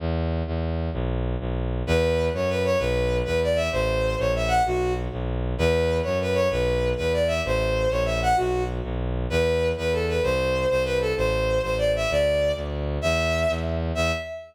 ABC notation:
X:1
M:6/8
L:1/8
Q:3/8=129
K:Em
V:1 name="Violin"
z6 | z6 | B3 ^c B c | B3 B d e |
c3 ^c e f | F2 z4 | B3 ^c B c | B3 B d e |
c3 ^c e f | F2 z4 | B3 B A B | c3 c B A |
c3 c d e | d3 z3 | e4 z2 | e3 z3 |]
V:2 name="Violin" clef=bass
E,,3 E,,3 | B,,,3 B,,,3 | E,,3 F,,3 | B,,,3 E,,3 |
A,,,3 ^A,,,3 | B,,,3 B,,,3 | E,,3 F,,3 | B,,,3 E,,3 |
A,,,3 ^A,,,3 | B,,,3 B,,,3 | E,,3 E,,3 | C,,3 C,,3 |
A,,,3 A,,,3 | D,,3 D,,3 | E,,3 E,,3 | E,,3 z3 |]